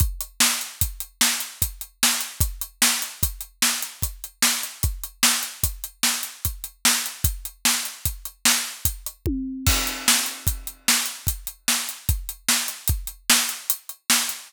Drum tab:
CC |------------|------------|------------|------------|
HH |xx-xxx-xxx-x|xx-xxx-xxx-x|xx-xxx-xxx-x|xx-xxx--xx--|
SD |--o---o---o-|--o---o---o-|--o---o---o-|--o---o-----|
T1 |------------|------------|------------|----------o-|
BD |o---o---o---|o---o---o---|o---o---o---|o---o---o-o-|

CC |x-----------|------------|
HH |-x-xxx-xxx-x|xx-xxx-xxx-x|
SD |--o---o---o-|--o---o---o-|
T1 |------------|------------|
BD |o---o---o---|o---o-------|